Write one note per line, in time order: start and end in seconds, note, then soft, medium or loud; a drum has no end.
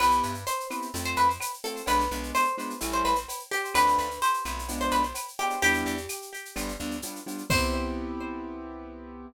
0.00 0.22 C2 loud
0.00 0.33 B3 loud
0.00 0.33 C4 medium
0.00 0.33 E4 loud
0.00 0.33 G4 medium
0.00 0.40 B4 medium
0.00 cowbell medium
0.00 claves loud
0.00 shaker medium
0.10 snare medium
0.10 shaker medium
0.23 0.45 G2 medium
0.23 shaker medium
0.34 shaker medium
0.47 0.67 C5 medium
0.47 shaker loud
0.60 shaker medium
0.70 0.87 B3 medium
0.70 0.87 C4 medium
0.70 0.87 E4 medium
0.70 0.87 G4 medium
0.70 claves medium
0.70 shaker medium
0.82 shaker medium
0.94 1.15 F2 loud
0.94 1.27 A3 loud
0.94 1.27 C4 loud
0.94 1.27 F4 loud
0.94 cowbell medium
0.94 shaker loud
1.04 1.17 C5 medium
1.04 shaker medium
1.16 1.38 F2 medium
1.16 1.28 B4 medium
1.16 shaker medium
1.30 shaker medium
1.40 cowbell medium
1.40 claves loud
1.40 shaker loud
1.54 shaker medium
1.64 1.81 A3 medium
1.64 1.81 C4 medium
1.64 1.81 F4 medium
1.64 1.83 A4 medium
1.64 cowbell medium
1.64 shaker medium
1.76 shaker medium
1.86 2.08 B1 loud
1.86 2.04 G#3 medium
1.86 2.04 B3 loud
1.86 2.04 D4 loud
1.86 2.04 F4 loud
1.86 2.28 B4 medium
1.86 cowbell loud
1.86 shaker medium
1.99 snare medium
1.99 shaker medium
2.11 2.32 B1 loud
2.11 2.45 G#3 medium
2.11 2.45 B3 medium
2.11 2.45 D4 medium
2.11 2.45 F4 medium
2.11 shaker medium
2.23 shaker medium
2.35 2.55 C5 medium
2.35 claves medium
2.35 shaker medium
2.44 shaker medium
2.58 2.74 G#3 medium
2.58 2.74 B3 medium
2.58 2.74 D4 medium
2.58 2.74 F4 medium
2.58 shaker medium
2.70 shaker medium
2.80 3.03 A1 loud
2.80 3.14 G3 loud
2.80 3.14 A3 loud
2.80 3.14 C#4 loud
2.80 3.14 E4 loud
2.80 cowbell medium
2.80 claves medium
2.80 shaker loud
2.92 3.04 C5 medium
2.92 shaker medium
3.05 3.26 A1 medium
3.05 3.16 B4 medium
3.05 shaker medium
3.15 shaker medium
3.29 cowbell medium
3.29 shaker loud
3.39 shaker medium
3.51 3.74 G4 medium
3.51 cowbell medium
3.51 shaker medium
3.64 shaker medium
3.74 3.96 D2 loud
3.74 4.07 A3 medium
3.74 4.07 C4 loud
3.74 4.07 D4 medium
3.74 4.07 F4 loud
3.74 4.17 B4 medium
3.74 cowbell medium
3.74 claves loud
3.74 shaker loud
3.87 snare medium
3.87 shaker medium
3.98 4.20 D2 medium
3.98 shaker medium
4.11 shaker medium
4.22 4.44 C5 medium
4.22 shaker medium
4.34 shaker medium
4.45 4.90 B1 loud
4.45 4.62 A3 medium
4.45 4.62 C4 medium
4.45 4.62 D4 medium
4.45 4.62 F4 medium
4.45 claves medium
4.45 shaker medium
4.59 shaker medium
4.68 5.02 G#3 loud
4.68 5.02 B3 loud
4.68 5.02 D4 loud
4.68 5.02 F4 medium
4.68 cowbell medium
4.68 shaker medium
4.81 4.92 C5 medium
4.81 shaker medium
4.91 5.13 B1 medium
4.91 5.03 B4 medium
4.91 shaker medium
5.03 shaker medium
5.14 cowbell medium
5.14 claves medium
5.14 shaker loud
5.28 shaker medium
5.39 5.55 G#3 medium
5.39 5.55 B3 medium
5.39 5.55 D4 medium
5.39 5.55 F4 medium
5.39 5.60 G4 medium
5.39 cowbell medium
5.39 shaker medium
5.50 shaker medium
5.62 5.84 E2 loud
5.62 5.95 G3 loud
5.62 5.95 B3 loud
5.62 5.95 D4 loud
5.62 5.95 E4 loud
5.62 6.54 G4 medium
5.62 cowbell loud
5.62 shaker medium
5.74 snare soft
5.74 shaker medium
5.86 6.07 E2 loud
5.86 shaker medium
5.97 shaker medium
6.09 claves medium
6.09 shaker loud
6.22 shaker medium
6.34 shaker medium
6.45 shaker medium
6.56 6.77 G1 loud
6.56 6.72 G3 loud
6.56 6.72 B3 loud
6.56 6.72 D4 loud
6.56 6.72 F4 loud
6.56 cowbell medium
6.56 claves medium
6.56 shaker medium
6.68 shaker medium
6.79 7.01 D2 loud
6.79 6.96 G3 medium
6.79 6.96 B3 medium
6.79 6.96 D4 medium
6.79 6.96 F4 medium
6.79 shaker medium
6.91 shaker medium
7.02 7.20 G3 medium
7.02 7.20 B3 medium
7.02 7.20 D4 medium
7.02 7.20 F4 medium
7.02 cowbell medium
7.02 shaker loud
7.16 shaker medium
7.26 7.43 G3 medium
7.26 7.43 B3 medium
7.26 7.43 D4 medium
7.26 7.43 F4 medium
7.26 cowbell medium
7.26 shaker medium
7.38 shaker medium
7.50 9.26 C2 loud
7.50 9.26 B3 loud
7.50 9.26 C4 loud
7.50 9.26 E4 loud
7.50 9.26 G4 loud
7.50 9.26 C5 loud
7.50 kick loud
7.50 crash loud